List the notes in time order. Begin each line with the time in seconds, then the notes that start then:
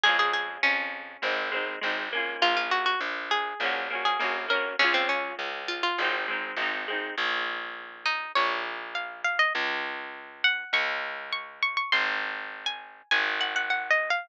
0.03 F2 G#3 C#4 G#4
0.09 F4
0.19 G#4
0.33 G#4
0.63 F2 C#4
1.22 G#1 G#3 C4
1.26 D#4
1.51 G#3 C4
1.56 D#4
1.81 G#1 G#3 C4
1.86 D#4
2.12 A#3 C#4
2.17 F4
2.42 A#1 F4
2.57 F4
2.71 F#4
2.86 F#4
3.00 A#1
3.31 G#4
3.60 A#1 A#3 C#4
3.65 F#4
3.90 A#3 C#4
3.95 F#4
4.05 G#4
4.19 A#1 A#3 C#4
4.24 F#4
4.48 A#3 C#4 A#4
4.53 F#4
4.79 C#2 G#3 C#4
4.84 F4
4.94 C4
5.09 C#4
5.39 C#2
5.68 F4
5.83 F4
5.98 G#1 G#3 C4
6.04 D#4
6.28 G#3 C4
6.32 D#4
6.56 G#1 G#3 C4
6.62 D#4
6.88 G#3 C4
6.92 D#4
7.17 A#1
8.05 D#4
8.35 A#1 C#5
8.95 F5
9.24 F5
9.39 D#5
9.55 C#2
10.44 F#5
10.73 C#2 C#6
11.32 C#6
11.62 C#6
11.77 C#6
11.92 G#1 C6
12.66 G#5
13.11 G#1 G#5
13.41 F#5
13.56 F#5
13.70 F#5
13.90 D#5
14.10 F5